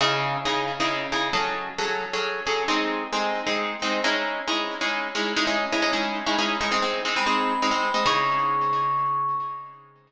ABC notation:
X:1
M:3/4
L:1/16
Q:1/4=134
K:C#m
V:1 name="Tubular Bells"
z12 | z12 | z12 | z12 |
z12 | z4 b8 | c'12 |]
V:2 name="Orchestral Harp"
[C,DEG]4 [C,DEG]3 [C,DEG]3 [C,DEG]2 | [F,CGA]4 [F,CGA]3 [F,CGA]3 [F,CGA]2 | [G,^B,D]4 [G,B,D]3 [G,B,D]3 [G,B,D]2 | [G,CDE]4 [G,CDE]3 [G,CDE]3 [G,CDE]2 |
[G,CDE] [G,CDE]2 [G,CDE] [G,CDE] [G,CDE]3 [G,CDE] [G,CDE]2 [G,CDE] | [G,^B,D] [G,B,D]2 [G,B,D] [G,B,D] [G,B,D]3 [G,B,D] [G,B,D]2 [G,B,D] | [C,DEG]12 |]